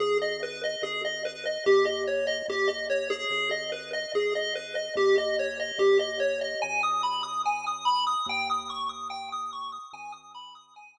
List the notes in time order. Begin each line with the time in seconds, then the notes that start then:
0.00 G#1 G#4
0.21 D#5
0.43 B4
0.63 D#5
0.82 G#1 G#4
1.05 D#5
1.25 B4
1.45 D#5
1.66 D#2 G4
1.85 D#5
2.07 C#5
2.27 D#5
2.48 D#2 G4
2.67 D#5
2.90 C#5
3.10 G#4
3.30 G#1
3.51 D#5
3.72 B4
3.93 D#5
4.14 G#1 G#4
4.35 D#5
4.55 B4
4.75 D#5
4.95 D#2 G4
5.18 D#5
5.39 C#5
5.59 D#5
5.78 D#2 G4
5.99 D#5
6.20 C#5
6.41 D#5
6.62 G#1 G#5
6.83 D#6
7.03 B5
7.23 D#6
7.45 G#5
7.66 D#6
7.85 B5
8.06 D#6
8.26 D#2 G5
8.50 D#6
8.70 C#6
8.89 D#6
9.10 G5
9.32 D#6
9.52 C#6
9.72 D#6
9.93 G#1 G#5
10.12 D#6
10.34 B5
10.55 D#6
10.76 G#5
10.97 D#6